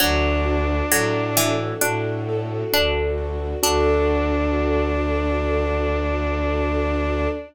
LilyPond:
<<
  \new Staff \with { instrumentName = "Violin" } { \time 4/4 \key d \major \tempo 4 = 66 d'2 r2 | d'1 | }
  \new Staff \with { instrumentName = "Harpsichord" } { \time 4/4 \key d \major fis8. r16 fis8 e8 d'4 d'4 | d'1 | }
  \new Staff \with { instrumentName = "Acoustic Grand Piano" } { \time 4/4 \key d \major d'8 fis'8 a'8 d'8 fis'8 a'8 d'8 fis'8 | <d' fis' a'>1 | }
  \new Staff \with { instrumentName = "Violin" } { \clef bass \time 4/4 \key d \major d,4 a,4 a,4 d,4 | d,1 | }
  \new Staff \with { instrumentName = "String Ensemble 1" } { \time 4/4 \key d \major <d' fis' a'>1 | <d' fis' a'>1 | }
>>